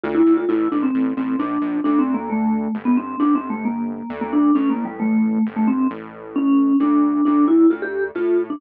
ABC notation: X:1
M:3/4
L:1/16
Q:1/4=133
K:Dm
V:1 name="Vibraphone"
F E2 F | E2 D C3 C2 D4 | (3D2 C2 B,2 A,4 z =B, C2 | (3D2 C2 A,2 B,4 z B, D2 |
(3^C2 B,2 G,2 A,4 z A, =C2 | z4 ^C4 D4 | D2 E2 F G2 z F2 z D |]
V:2 name="Synth Bass 1" clef=bass
D,,2 D,,2 | A,,,2 A,,,2 A,,,2 A,,,2 B,,,2 B,,,2 | D,,8 G,,,4 | G,,,8 D,,4 |
A,,,8 G,,,4 | A,,,8 D,,4 | D,,4 D,,4 A,,4 |]